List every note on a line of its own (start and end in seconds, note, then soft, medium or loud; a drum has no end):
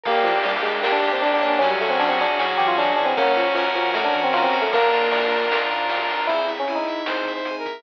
0.03 0.22 G1 medium
0.03 0.64 A#3 loud
0.03 0.26 A#3 medium
0.03 0.70 G4 medium
0.03 0.39 A#4 loud
0.03 1.59 A#4 medium
0.03 1.59 D5 medium
0.03 0.39 D5 loud
0.03 1.59 G5 medium
0.03 kick medium
0.03 crash medium
0.08 0.39 G5 loud
0.24 0.58 G1 medium
0.24 0.33 F3 medium
0.24 0.82 D4 medium
0.24 ride medium
0.43 0.54 G3 medium
0.43 1.02 G4 medium
0.43 0.79 A#4 medium
0.43 0.79 D5 medium
0.43 ride medium
0.49 0.79 G5 medium
0.63 0.80 G1 medium
0.63 0.80 G#3 medium
0.63 1.22 A#3 medium
0.63 ride medium
0.81 0.99 A#1 medium
0.81 0.92 A#3 medium
0.81 1.40 D4 loud
0.81 1.21 G4 loud
0.81 1.17 A#4 medium
0.81 1.17 D5 medium
0.81 snare medium
0.86 1.17 G5 loud
0.92 1.10 D4 medium
1.02 1.36 F2 medium
1.02 1.58 G4 medium
1.02 ride medium
1.12 1.22 C4 medium
1.22 1.59 A#3 medium
1.22 1.31 D4 medium
1.22 1.39 D4 medium
1.22 1.41 A#4 medium
1.22 1.41 D5 medium
1.22 ride medium
1.27 1.41 G5 medium
1.34 1.49 D4 medium
1.41 1.58 G1 medium
1.41 1.60 A#3 medium
1.41 1.59 D4 medium
1.41 1.96 C#5 loud
1.41 1.96 F#5 loud
1.41 kick medium
1.41 snare soft
1.41 ride medium
1.46 1.59 D4 medium
1.46 1.96 G#5 medium
1.59 1.78 F#2 medium
1.59 2.25 F#3 loud
1.59 1.68 C#4 medium
1.59 2.19 C#4 loud
1.59 3.14 C#5 medium
1.59 3.14 F#5 medium
1.59 3.14 G#5 medium
1.59 kick medium
1.59 ride medium
1.70 1.79 G3 medium
1.81 2.14 F#2 medium
1.81 1.90 A3 medium
1.81 2.39 F#4 medium
1.81 ride medium
1.90 1.99 C4 medium
1.99 2.09 D4 medium
1.99 2.58 G#4 medium
1.99 2.34 C#5 medium
1.99 2.34 F#5 medium
1.99 ride medium
2.03 2.34 G#5 medium
2.09 2.18 C4 medium
2.19 2.36 F#2 medium
2.19 2.78 C#4 medium
2.19 2.38 D4 medium
2.19 ride medium
2.39 2.55 A2 medium
2.39 2.74 F#3 medium
2.39 2.48 C#4 medium
2.39 2.97 F#4 loud
2.39 2.74 C#5 medium
2.39 2.74 F#5 medium
2.39 snare medium
2.44 2.74 G#5 medium
2.58 2.91 E3 medium
2.58 2.67 G4 medium
2.58 3.14 G#4 medium
2.58 ride medium
2.68 2.77 F4 medium
2.78 2.94 F#3 medium
2.78 3.15 C#4 medium
2.78 2.96 D4 medium
2.78 3.14 C#5 medium
2.78 3.14 F#5 medium
2.78 ride medium
2.83 3.14 G#5 medium
2.96 3.14 F#2 medium
2.96 3.13 E3 medium
2.96 3.06 D4 medium
2.96 3.16 F#4 medium
2.96 kick medium
2.96 ride soft
3.06 3.15 C4 medium
3.16 3.33 F#2 medium
3.16 3.36 A#3 medium
3.16 3.74 C#4 loud
3.16 3.68 C#4 loud
3.16 4.70 C#5 medium
3.16 3.54 C#5 loud
3.16 4.70 F#5 medium
3.16 4.70 A#5 medium
3.16 kick medium
3.16 ride medium
3.21 3.54 F#5 loud
3.21 3.54 A#5 loud
3.36 3.70 F#2 medium
3.36 3.46 F3 medium
3.36 3.94 F#4 medium
3.36 ride medium
3.55 3.64 F3 medium
3.55 4.13 A#4 medium
3.55 3.90 C#5 medium
3.55 3.90 F#5 medium
3.55 ride medium
3.60 3.90 A#5 medium
3.75 3.92 F#2 medium
3.75 3.93 F3 medium
3.75 4.34 C#4 medium
3.75 ride medium
3.94 4.11 A2 medium
3.94 4.04 A3 medium
3.94 4.52 F#4 medium
3.94 4.29 C#5 medium
3.94 4.29 F#5 medium
3.94 snare medium
3.99 4.29 A#5 loud
4.04 4.21 D4 medium
4.14 4.47 E3 medium
4.14 4.69 A#4 medium
4.14 kick medium
4.14 ride medium
4.24 4.33 C4 medium
4.33 4.68 C#4 medium
4.33 4.71 C#4 medium
4.33 4.43 F4 medium
4.33 4.68 C#5 medium
4.33 4.68 F#5 medium
4.33 ride medium
4.37 4.68 A#5 medium
4.43 4.60 C4 medium
4.52 4.69 F#2 medium
4.52 4.71 F#4 medium
4.52 kick medium
4.52 ride medium
4.62 4.71 A3 medium
4.72 4.89 A#1 medium
4.72 5.44 A#3 medium
4.72 5.31 D4 loud
4.72 5.59 A#4 loud
4.72 5.08 D5 loud
4.72 6.27 D5 medium
4.72 6.27 F5 medium
4.72 5.08 F5 loud
4.72 6.27 A#5 medium
4.72 kick medium
4.72 ride medium
4.77 5.08 A#5 loud
4.92 5.25 A#1 medium
4.92 5.50 F4 medium
4.92 ride medium
5.11 5.70 A#4 medium
5.11 5.47 D5 medium
5.11 5.47 F5 medium
5.11 ride medium
5.17 5.47 A#5 medium
5.31 5.48 A#1 medium
5.31 5.89 D4 medium
5.31 ride medium
5.50 5.67 C#2 medium
5.50 6.09 F4 medium
5.50 5.87 D5 medium
5.50 5.87 F5 medium
5.50 snare loud
5.56 5.87 A#5 medium
5.70 6.03 G#2 medium
5.70 6.26 A#4 medium
5.70 ride medium
5.89 6.26 D4 medium
5.89 6.24 D5 medium
5.89 6.24 F5 loud
5.89 ride medium
5.94 6.24 A#5 loud
6.09 6.25 A#1 medium
6.09 6.28 F4 medium
6.09 snare soft
6.09 ride medium
6.27 6.64 C4 medium
6.27 6.51 E4 medium
6.27 6.46 E4 medium
6.27 6.64 E4 medium
6.27 6.46 C5 medium
6.27 kick medium
6.27 closed hi-hat medium
6.33 6.64 G#4 medium
6.48 6.65 E5 medium
6.48 closed hi-hat medium
6.59 6.76 C#4 medium
6.67 7.02 C4 medium
6.67 7.02 E4 medium
6.67 6.85 G#5 medium
6.67 closed hi-hat medium
6.72 7.65 D#4 medium
6.72 7.02 G#4 medium
6.86 7.05 E5 medium
6.86 closed hi-hat medium
7.05 7.41 C4 medium
7.05 7.41 E4 medium
7.05 7.31 C5 medium
7.05 7.25 C5 medium
7.05 snare medium
7.10 7.41 G#4 medium
7.25 7.44 E5 medium
7.25 kick medium
7.25 snare soft
7.25 closed hi-hat medium
7.33 7.55 C5 medium
7.45 7.81 C4 medium
7.45 7.81 E4 medium
7.45 7.63 G#5 medium
7.45 closed hi-hat medium
7.51 7.81 G#4 medium
7.58 7.81 A#4 medium
7.65 7.83 E5 medium
7.65 kick medium
7.65 closed hi-hat medium